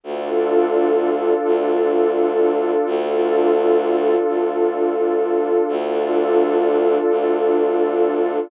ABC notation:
X:1
M:4/4
L:1/8
Q:1/4=85
K:Dm
V:1 name="Pad 2 (warm)"
[DFA]8 | [DFA]8 | [DFA]8 |]
V:2 name="Violin" clef=bass
D,,4 D,,4 | D,,4 D,,4 | D,,4 D,,4 |]